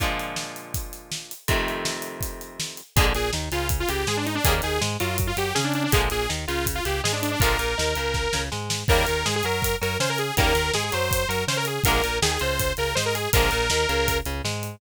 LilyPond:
<<
  \new Staff \with { instrumentName = "Lead 2 (sawtooth)" } { \time 4/4 \key bes \mixolydian \tempo 4 = 162 r1 | r1 | aes'16 r16 aes'8 r8 f'8 r16 f'16 g'8 aes'16 d'16 ees'16 d'16 | aes'16 r16 aes'8 r8 f'8 r16 f'16 g'8 aes'16 d'16 d'16 d'16 |
aes'16 r16 aes'8 r8 f'8 r16 f'16 g'8 aes'16 d'16 d'16 d'16 | bes'2. r4 | bes'4 aes'16 aes'16 bes'4 bes'8 c''16 bes'16 aes'8 | bes'4 aes'16 aes'16 c''4 bes'8 c''16 bes'16 aes'8 |
bes'4 aes'16 aes'16 c''4 bes'8 c''16 bes'16 aes'8 | bes'2~ bes'8 r4. | }
  \new Staff \with { instrumentName = "Overdriven Guitar" } { \time 4/4 \key bes \mixolydian <bes, d f aes>1 | <f, c ees a>1 | <f, d aes bes>8 bes,8 ees8 des4 des8 aes4 | <des ees g bes>8 ees8 aes8 ges4 ges8 des'4 |
<d f aes bes>8 bes,8 ees8 des4 des8 aes4 | <d f aes bes>8 bes,8 ees8 des4 des8 aes4 | <des ees g bes>8 ees8 aes8 ges4 ges8 des'4 | <des ees g bes>8 ees8 aes8 ges4 ges8 des'4 |
<d f aes bes>8 bes,8 ees8 des4 des8 aes4 | <d f aes bes>8 bes,8 ees8 des4 des8 aes4 | }
  \new Staff \with { instrumentName = "Synth Bass 1" } { \clef bass \time 4/4 \key bes \mixolydian r1 | r1 | bes,,8 bes,,8 ees,8 des,4 des,8 aes,4 | ees,8 ees,8 aes,8 ges,4 ges,8 des4 |
bes,,8 bes,,8 ees,8 des,4 des,8 aes,4 | bes,,8 bes,,8 ees,8 des,4 des,8 aes,4 | ees,8 ees,8 aes,8 ges,4 ges,8 des4 | ees,8 ees,8 aes,8 ges,4 ges,8 des4 |
bes,,8 bes,,8 ees,8 des,4 des,8 aes,4 | bes,,8 bes,,8 ees,8 des,4 des,8 aes,4 | }
  \new DrumStaff \with { instrumentName = "Drums" } \drummode { \time 4/4 <hh bd>8 hh8 sn8 hh8 <hh bd>8 hh8 sn8 hh8 | <hh bd>8 hh8 sn8 hh8 <hh bd>8 hh8 sn8 hh8 | <hh bd>8 hh8 sn8 hh8 <hh bd>8 hh8 sn8 hh8 | <hh bd>8 hh8 sn8 hh8 <hh bd>8 hh8 sn8 hh8 |
<hh bd>8 hh8 sn8 hh8 <hh bd>8 hh8 sn8 hh8 | <hh bd>8 hh8 sn8 hh8 <bd sn>8 sn8 sn8 sn8 | <cymc bd>8 hh8 sn8 hh8 <hh bd>8 hh8 sn8 hh8 | <hh bd>8 hh8 sn8 hh8 <hh bd>8 hh8 sn8 hh8 |
<hh bd>8 hh8 sn8 hh8 <hh bd>8 hh8 sn8 hh8 | <hh bd>8 hh8 sn8 hh8 <hh bd>8 hh8 sn8 hh8 | }
>>